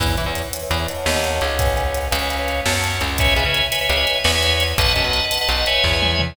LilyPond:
<<
  \new Staff \with { instrumentName = "Drawbar Organ" } { \time 9/8 \key e \major \tempo 4. = 113 <b' cis'' e'' gis''>8 <b' cis'' e'' gis''>16 <b' cis'' e'' gis''>8. <b' cis'' e'' gis''>16 <b' cis'' e'' gis''>16 <b' cis'' e'' gis''>16 <b' cis'' e'' gis''>16 <cis'' dis'' fis'' a''>8. <cis'' dis'' fis'' a''>4~ <cis'' dis'' fis'' a''>16 | <b' cis'' fis'' gis''>8 <b' cis'' fis'' gis''>16 <b' cis'' fis'' gis''>8. <b' cis'' eis'' gis''>16 <b' cis'' eis'' gis''>16 <b' cis'' eis'' gis''>16 <b' cis'' eis'' gis''>8. <cis'' fis'' a''>16 <cis'' fis'' a''>4~ <cis'' fis'' a''>16 | <b' cis'' e'' gis''>8 <b' cis'' e'' gis''>16 <b' cis'' e'' gis''>8. <b' cis'' e'' gis''>16 <b' cis'' e'' gis''>16 <b' cis'' e'' gis''>16 <b' cis'' e'' gis''>8. <b' cis'' e'' gis''>16 <b' cis'' e'' gis''>4~ <b' cis'' e'' gis''>16 | <b' dis'' fis'' a''>8 <b' dis'' fis'' a''>16 <b' dis'' fis'' a''>8. <b' dis'' fis'' a''>16 <b' dis'' fis'' a''>16 <b' dis'' fis'' a''>16 <b' dis'' fis'' a''>16 <b' cis'' e'' gis''>8. <b' cis'' e'' gis''>4~ <b' cis'' e'' gis''>16 | }
  \new Staff \with { instrumentName = "Electric Bass (finger)" } { \clef bass \time 9/8 \key e \major e,8 e16 e,4~ e,16 e,4 dis,4 cis,8~ | cis,4. cis,4. fis,4 cis,8~ | cis,8 cis,16 cis4~ cis16 cis,4 e,4. | b,,8 fis,16 b,,4~ b,,16 b,,4 e,4. | }
  \new DrumStaff \with { instrumentName = "Drums" } \drummode { \time 9/8 <hh bd>8 hh8 hh8 hh8 hh8 hh8 sn8 hh8 hh8 | <hh bd>8 hh8 hh8 hh8 hh8 hh8 sn8 hh8 hh8 | <hh bd>8 hh8 hh8 hh8 hh8 hh8 sn8 hh8 hh8 | <hh bd>8 hh8 hh8 hh8 hh8 hh8 <bd sn>8 tommh8 toml8 | }
>>